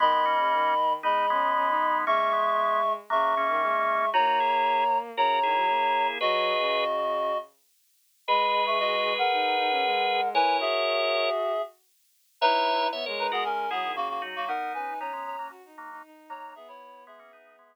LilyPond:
<<
  \new Staff \with { instrumentName = "Clarinet" } { \time 4/4 \key gis \minor \tempo 4 = 116 <dis'' b''>2 <dis'' b''>2 | <e'' cis'''>2 <e'' cis'''>2 | <cis'' ais''>2 <cis'' ais''>2 | <fis' dis''>2~ <fis' dis''>8 r4. |
<dis'' b''>8. <e'' cis'''>16 <fis' dis''>8. <ais' fis''>2~ <ais' fis''>16 | <b' gis''>8 <gis' e''>2 r4. | \key b \major <dis' b'>4 r8 <dis' b'>16 <b gis'>16 <cis' ais'>8 <b gis'>8 <ais fis'>16 <ais fis'>16 r16 <ais fis'>16 | <ais' fis''>8 <b' gis''>8 <cis'' ais''>8 <cis'' ais''>8 r4. <cis'' ais''>8 |
<gis' e''>16 <e' cis''>8. <gis' e''>2~ <gis' e''>8 r8 | }
  \new Staff \with { instrumentName = "Drawbar Organ" } { \time 4/4 \key gis \minor <gis b>16 <gis b>16 <ais cis'>4 r8 <b dis'>8 <gis b>4. | <ais cis'>16 <ais cis'>16 <gis b>4 r8 <fis ais>8 <ais cis'>4. | <dis' fis'>16 <dis' fis'>16 <e' gis'>4 r8 <fis' ais'>8 <e' gis'>4. | <gis' b'>4. r2 r8 |
<gis' b'>1 | <ais' cis''>2 r2 | \key b \major <cis'' e''>4 <cis'' e''>16 <ais' cis''>8 <fis' ais'>16 r8 <e' gis'>8 r8 <dis' fis'>8 | <b dis'>4 <b dis'>16 <gis b>8 <fis ais>16 r8 <fis ais>8 r8 <fis ais>8 |
r4 <gis b>16 <ais cis'>16 <b dis'>8 <gis b>4. r8 | }
  \new Staff \with { instrumentName = "Violin" } { \time 4/4 \key gis \minor dis16 dis8 cis16 dis4 gis8 cis'8 cis'16 dis'8. | gis2 cis8 cis16 dis16 gis4 | ais2 cis8 dis16 fis16 ais4 | fis8. cis4.~ cis16 r4. |
gis2 dis'8 dis'16 cis'16 gis4 | e'8 fis'2 r4. | \key b \major e'4 b16 gis8 gis8. fis16 dis16 cis8 fis16 fis16 | dis'8 cis'16 dis'16 cis'16 cis'8 cis'16 fis'16 dis'8 dis'16 dis'4 |
b2. r4 | }
>>